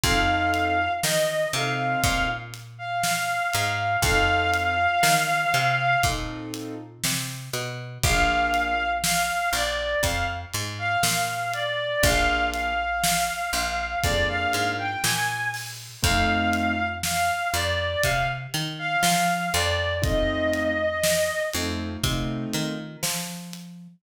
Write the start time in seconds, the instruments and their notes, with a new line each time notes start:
0.04 electric bass (finger) F2, acoustic grand piano C4 D#4 F4 A4, clarinet F5, kick, closed hi-hat
0.54 closed hi-hat
1.03 electric bass (finger) D#3, clarinet D#5, snare
1.53 electric bass (finger) C3, acoustic grand piano C4 D#4 F4 A4, clarinet F5, closed hi-hat
2.03 electric bass (finger) A#2, clarinet F5, kick, closed hi-hat
2.54 closed hi-hat
2.78 clarinet F5
3.03 clarinet F5, snare
3.54 electric bass (finger) G#2, clarinet F5, closed hi-hat
4.02 electric bass (finger) F2, acoustic grand piano C4 D#4 F4 A4, clarinet F5, kick, closed hi-hat
4.54 closed hi-hat
5.03 electric bass (finger) D#3, snare
5.54 electric bass (finger) C3, closed hi-hat
6.03 electric bass (finger) A#2, acoustic grand piano C4 D#4 F4 A4, kick, closed hi-hat
6.54 closed hi-hat
7.04 electric bass (finger) C3, snare
7.53 electric bass (finger) B2, closed hi-hat
8.03 electric bass (finger) A#1, acoustic grand piano A#3 D4 F4 G#4, clarinet F5, kick, closed hi-hat
8.54 closed hi-hat
9.04 clarinet F5, snare
9.53 electric bass (finger) A#1, clarinet D5, closed hi-hat
10.03 electric bass (finger) F2, clarinet F5, kick, closed hi-hat
10.54 electric bass (finger) G#2, closed hi-hat
10.79 clarinet F5
11.03 electric bass (finger) A#2, clarinet F5, snare
11.54 clarinet D5, closed hi-hat
12.03 electric bass (finger) A#1, acoustic grand piano A#3 D4 F4 G#4, clarinet F5, kick, closed hi-hat
12.54 clarinet F5, closed hi-hat
13.04 snare
13.53 electric bass (finger) A#1, closed hi-hat
14.03 electric bass (finger) F2, acoustic grand piano A#3 D4 F4 G#4, clarinet D5, kick, closed hi-hat
14.28 clarinet F5
14.53 electric bass (finger) G#2, closed hi-hat
14.78 clarinet G5
15.04 electric bass (finger) A#2, clarinet G#5, snare
15.54 open hi-hat
16.02 electric bass (finger) F2, acoustic grand piano A3 C4 D#4 F4, clarinet F5, kick, closed hi-hat
16.53 closed hi-hat
17.03 clarinet F5, snare
17.54 electric bass (finger) F2, clarinet D5, closed hi-hat
18.03 electric bass (finger) C3, clarinet F5, kick, closed hi-hat
18.54 electric bass (finger) D#3, closed hi-hat
18.79 clarinet F5
19.03 electric bass (finger) F3, clarinet F5, snare
19.54 electric bass (finger) F2, clarinet D5, closed hi-hat
20.02 acoustic grand piano A3 C4 D#4 F4, clarinet D#5, kick, closed hi-hat
20.54 closed hi-hat
21.04 snare
21.53 electric bass (finger) F2, acoustic grand piano A3 C4 D#4 F4, closed hi-hat
22.03 electric bass (finger) C3, acoustic grand piano A3 C4 D#4 F4, kick, closed hi-hat
22.53 electric bass (finger) D#3, closed hi-hat
23.03 electric bass (finger) F3, snare
23.53 closed hi-hat